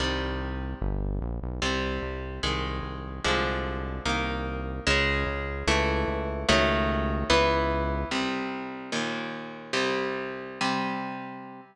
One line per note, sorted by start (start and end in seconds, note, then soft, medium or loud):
0.00 0.74 C2 medium
0.00 0.79 C3 medium
0.00 0.79 D#3 medium
0.00 0.79 G3 medium
0.82 1.20 G1 loud
1.21 1.39 A#1 medium
1.42 1.60 B1 medium
1.62 1.99 C2 medium
1.62 2.41 C3 medium
1.62 2.41 G3 medium
2.02 2.40 C2 medium
2.43 2.81 C2 medium
2.43 3.23 D#3 medium
2.43 3.23 G#3 medium
2.83 3.20 C2 medium
3.24 4.00 C2 medium
3.24 4.04 D3 medium
3.24 4.04 F3 medium
3.24 4.04 G#3 medium
4.05 4.80 C2 medium
4.05 4.85 D#3 medium
4.05 4.85 A#3 medium
4.87 5.25 C#2 loud
4.87 5.66 C#3 loud
4.87 5.66 G#3 loud
5.27 5.64 C#2 medium
5.67 6.05 C#2 loud
5.67 6.47 E3 loud
5.67 6.47 A3 loud
6.08 6.45 C#2 medium
6.49 7.24 C#2 loud
6.49 7.28 D#3 loud
6.49 7.28 F#3 loud
6.49 7.28 A3 loud
7.30 8.05 C#2 loud
7.30 8.09 E3 loud
7.30 8.09 B3 loud
8.11 8.91 C2 medium
8.11 8.91 C3 medium
8.11 8.91 G3 medium
8.92 9.72 D#2 medium
8.92 9.72 A#2 medium
8.92 9.72 D#3 medium
9.73 10.59 C2 medium
9.73 10.59 C3 medium
9.73 10.59 G3 medium
10.61 11.61 C3 medium
10.61 11.61 G3 medium